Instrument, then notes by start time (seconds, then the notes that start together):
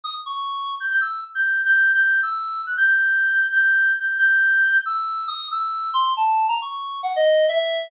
clarinet
0.04 D#6
0.26 C#6
0.80 G6
0.90 G6
1.01 E6
1.35 G6
1.65 G6
1.94 G6
2.23 E6
2.66 F#6
2.77 G6
2.87 G6
3.52 G6
3.99 G6
4.18 G6
4.86 E6
5.28 D#6
5.51 E6
5.94 C6
6.17 A5
6.48 A#5
6.62 C#6
7.03 F#5
7.16 D#5
7.48 E5